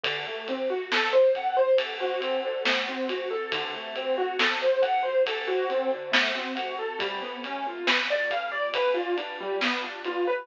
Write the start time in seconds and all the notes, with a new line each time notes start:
0.03 D3, kick, ride
0.27 A3
0.48 C4, ride
0.70 F#4
0.92 A4, snare
1.13 C5
1.35 F#5, kick, ride
1.57 C5
1.78 A4, kick, ride
2.01 F#4
2.20 C4, ride
2.45 D3
2.65 A3, snare
2.88 C4
3.09 F#4, ride
3.31 A4
3.52 D3, kick, ride
3.74 A3
3.96 C4, ride
4.18 F#4
4.39 A4, snare
4.62 C5
4.82 F#5, kick, ride
5.03 C5
5.26 A4, kick, ride
5.47 F#4
5.70 C4, ride
5.93 D3
6.12 A3, snare
6.35 C4
6.55 F#4, ride
6.79 A4
6.99 G3, kick, ride
7.22 B3
7.44 C#4, ride
7.67 F4
7.87 B4, snare
8.10 D5
8.31 F5, kick, ride
8.52 D5
8.74 B4, kick, ride
8.94 F4
9.17 D4, ride
9.41 G3
9.61 B3, snare
9.83 D4
10.05 F4, ride
10.27 B4